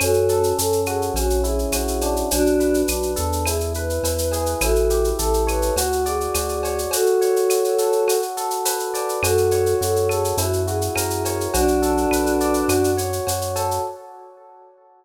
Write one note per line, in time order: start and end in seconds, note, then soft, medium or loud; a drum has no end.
0.00 0.53 F#2 loud
0.00 0.58 C#4 medium
0.00 0.53 F#4 medium
0.00 0.53 A4 loud
0.00 cowbell loud
0.00 claves loud
0.00 shaker loud
0.14 shaker medium
0.29 1.12 A4 medium
0.29 shaker medium
0.43 shaker medium
0.57 1.11 F#2 medium
0.57 1.13 C#4 medium
0.57 0.81 A4 medium
0.57 shaker loud
0.72 shaker medium
0.86 1.14 F#4 medium
0.86 1.12 G#4 medium
0.86 claves loud
0.86 shaker medium
1.02 shaker medium
1.14 1.66 A#1 loud
1.14 2.25 C#4 medium
1.14 1.40 F#4 medium
1.14 cowbell loud
1.14 shaker loud
1.30 shaker medium
1.44 2.26 E4 medium
1.44 2.16 G#4 medium
1.44 shaker medium
1.59 shaker medium
1.72 2.24 A#1 medium
1.72 2.27 F#4 medium
1.72 cowbell medium
1.72 claves loud
1.72 shaker loud
1.88 shaker medium
2.01 2.88 D4 medium
2.01 cowbell medium
2.01 shaker loud
2.16 shaker medium
2.31 2.84 B1 loud
2.31 2.82 D4 loud
2.31 2.82 F#4 loud
2.31 cowbell loud
2.31 shaker loud
2.46 shaker medium
2.60 3.42 B4 medium
2.60 shaker medium
2.74 shaker medium
2.88 3.16 B1 medium
2.88 3.43 D4 medium
2.88 3.11 F#4 medium
2.88 claves loud
2.88 shaker loud
3.03 shaker medium
3.16 3.99 E2 loud
3.16 3.44 A4 medium
3.16 shaker loud
3.32 shaker medium
3.46 4.04 E4 medium
3.46 3.72 G#4 medium
3.46 cowbell loud
3.46 claves loud
3.46 shaker loud
3.60 shaker medium
3.74 4.57 B4 medium
3.74 4.58 B4 medium
3.74 shaker medium
3.90 shaker medium
4.03 4.55 E2 medium
4.03 4.59 E4 medium
4.03 cowbell medium
4.03 shaker loud
4.18 shaker loud
4.31 4.60 G#4 medium
4.31 cowbell medium
4.31 shaker loud
4.46 shaker medium
4.61 5.13 A1 loud
4.61 5.71 E4 medium
4.61 5.08 F#4 medium
4.61 5.08 A4 loud
4.61 cowbell loud
4.61 claves loud
4.61 shaker loud
4.75 shaker medium
4.90 5.73 G4 medium
4.90 shaker loud
5.04 shaker medium
5.19 5.71 A1 loud
5.19 5.74 A4 medium
5.19 5.43 A4 medium
5.19 shaker loud
5.34 shaker medium
5.47 5.75 B4 medium
5.47 5.74 C#5 medium
5.47 claves loud
5.47 shaker medium
5.62 shaker medium
5.76 6.28 D2 loud
5.76 6.04 F#4 medium
5.76 6.35 F#4 medium
5.76 cowbell loud
5.76 shaker loud
5.92 shaker medium
6.06 6.79 G#4 medium
6.06 6.88 D5 medium
6.06 shaker medium
6.21 shaker medium
6.34 6.87 D2 medium
6.34 6.90 F#4 medium
6.34 cowbell medium
6.34 claves medium
6.34 shaker loud
6.49 shaker medium
6.63 6.92 C#5 medium
6.63 cowbell loud
6.63 shaker medium
6.78 shaker medium
6.91 8.17 F#4 medium
6.91 7.51 F#4 medium
6.91 8.17 A4 loud
6.91 cowbell loud
6.91 shaker loud
7.06 shaker medium
7.21 8.03 C#5 medium
7.21 shaker medium
7.36 shaker medium
7.50 8.06 F#4 medium
7.50 claves loud
7.50 shaker loud
7.64 shaker medium
7.78 8.06 A4 medium
7.78 shaker loud
7.92 shaker medium
8.07 9.17 F#4 medium
8.07 cowbell medium
8.07 claves medium
8.07 shaker loud
8.22 shaker medium
8.37 9.19 A4 medium
8.37 shaker medium
8.50 shaker medium
8.65 9.20 B4 medium
8.65 cowbell loud
8.65 shaker loud
8.79 shaker medium
8.94 9.21 D5 medium
8.94 cowbell medium
8.94 shaker medium
9.09 shaker medium
9.23 9.75 F#2 loud
9.23 9.75 F#4 loud
9.23 9.81 F#4 medium
9.23 9.75 A4 loud
9.23 cowbell loud
9.23 claves loud
9.23 shaker loud
9.37 shaker medium
9.51 10.34 C#5 medium
9.51 shaker loud
9.66 shaker medium
9.81 10.33 F#2 loud
9.81 10.36 F#4 medium
9.81 10.08 A4 medium
9.81 shaker loud
9.96 shaker medium
10.09 10.36 G#4 medium
10.09 10.37 A4 medium
10.09 claves loud
10.09 shaker medium
10.25 shaker medium
10.37 10.89 F#2 loud
10.37 11.48 E4 medium
10.37 10.62 F#4 medium
10.37 cowbell loud
10.37 shaker loud
10.53 shaker medium
10.67 11.50 F#4 medium
10.67 11.48 G#4 medium
10.67 shaker medium
10.81 shaker medium
10.95 11.48 F#2 medium
10.95 11.51 A#4 medium
10.95 cowbell loud
10.95 claves loud
10.95 shaker loud
11.10 shaker medium
11.25 11.53 C#5 medium
11.25 cowbell medium
11.25 shaker loud
11.41 shaker medium
11.53 12.06 B1 loud
11.53 12.90 D4 loud
11.53 12.63 F#4 loud
11.53 12.90 F#4 loud
11.53 cowbell loud
11.53 shaker loud
11.68 shaker medium
11.82 12.64 A4 medium
11.82 shaker loud
11.97 shaker medium
12.11 12.63 B1 medium
12.11 12.66 B4 medium
12.11 claves loud
12.11 shaker loud
12.26 shaker medium
12.40 12.68 D5 medium
12.40 shaker medium
12.54 shaker medium
12.68 13.20 F#2 loud
12.68 13.27 F#4 medium
12.68 cowbell medium
12.68 claves loud
12.68 shaker loud
12.84 shaker medium
12.97 13.80 C#5 medium
12.97 shaker loud
13.13 shaker medium
13.27 13.79 F#2 medium
13.27 13.82 F#4 medium
13.27 cowbell medium
13.27 shaker loud
13.41 shaker medium
13.56 13.83 A4 medium
13.56 cowbell medium
13.56 shaker loud
13.71 shaker medium